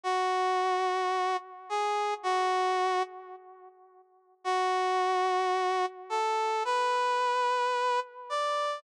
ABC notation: X:1
M:4/4
L:1/8
Q:1/4=109
K:Bdor
V:1 name="Brass Section"
F6 G2 | F3 z5 | F6 A2 | B6 d2 |]